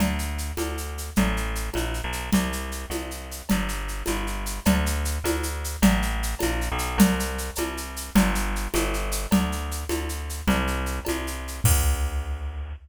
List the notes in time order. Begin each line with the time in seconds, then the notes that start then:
0.00 D2, cowbell, low conga, shaker
0.19 shaker
0.38 shaker
0.57 D2, cowbell, high conga, shaker
0.78 shaker
0.98 shaker
1.16 A1, cowbell, low conga, shaker
1.37 shaker
1.55 shaker
1.74 A#1, cowbell, high conga, shaker
1.94 shaker
2.04 B1
2.12 shaker
2.33 C2, cowbell, low conga, shaker
2.53 shaker
2.72 shaker
2.90 C2, cowbell, high conga, shaker
3.11 shaker
3.31 shaker
3.49 G1, cowbell, low conga, shaker
3.68 shaker
3.88 shaker
4.06 G1, cowbell, high conga, shaker
4.27 shaker
4.46 shaker
4.65 D2, cowbell, low conga, shaker
4.86 shaker
5.05 shaker
5.24 D2, cowbell, high conga, shaker
5.43 shaker
5.64 shaker
5.82 A1, cowbell, low conga, shaker
6.02 shaker
6.23 shaker
6.39 A#1, cowbell, high conga, shaker
6.61 shaker
6.72 B1
6.78 shaker
6.98 C2, cowbell, low conga, shaker
7.20 shaker
7.38 shaker
7.55 C2, cowbell, high conga, shaker
7.77 shaker
7.96 shaker
8.15 G1, cowbell, low conga, shaker
8.35 shaker
8.56 shaker
8.74 G1, cowbell, high conga, shaker
8.94 shaker
9.11 shaker
9.31 D2, cowbell, low conga, shaker
9.52 shaker
9.71 shaker
9.89 D2, cowbell, high conga, shaker
10.09 shaker
10.29 shaker
10.47 C2, cowbell, low conga, shaker
10.67 shaker
10.86 shaker
11.05 C2, cowbell, high conga, shaker
11.27 shaker
11.48 shaker
11.64 D2, kick, crash